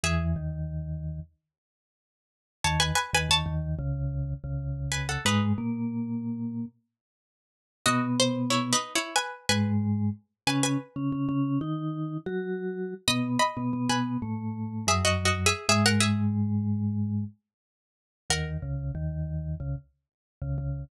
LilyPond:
<<
  \new Staff \with { instrumentName = "Pizzicato Strings" } { \time 4/4 \key gis \minor \tempo 4 = 92 <gis' e''>1 | <cis'' a''>16 <b' gis''>16 <b' gis''>16 <b' gis''>16 <cis'' a''>4 r4. <b' gis''>16 <a' fis''>16 | <dis' b'>2. r4 | <fis' dis''>8 bis'8 \tuplet 3/2 { <e' cis''>8 <dis' b'>8 <e' cis''>8 } <b' gis''>8 <b' gis''>4. |
<b' gis''>16 <b' gis''>2~ <b' gis''>8. r4 | <dis'' b''>8 <dis'' b''>8. <b' gis''>4. <gis' e''>16 \tuplet 3/2 { <fis' dis''>8 <fis' dis''>8 <gis' e''>8 } | <gis' e''>16 <ais' fis''>16 <gis' e''>2~ <gis' e''>8 r4 | <ais' fis''>1 | }
  \new Staff \with { instrumentName = "Vibraphone" } { \time 4/4 \key gis \minor <e, e>8 <dis, dis>4. r2 | <dis, dis>8 r16 <dis, dis>16 <dis, dis>16 <dis, dis>8 <cis, cis>4 <cis, cis>4~ <cis, cis>16 | <gis, gis>8 <ais, ais>2 r4. | <b, b>4. r4 <gis, gis>4 r8 |
<cis cis'>8 r16 <cis cis'>16 <cis cis'>16 <cis cis'>8 <dis dis'>4 <fis fis'>4~ <fis fis'>16 | <b, b>8 r16 <b, b>16 <b, b>16 <b, b>8 <a, a>4 <fis, fis>4~ <fis, fis>16 | <gis, gis>2~ <gis, gis>8 r4. | <dis, dis>8 <cis, cis>8 <dis, dis>4 <cis, cis>16 r4 <cis, cis>16 <cis, cis>8 | }
>>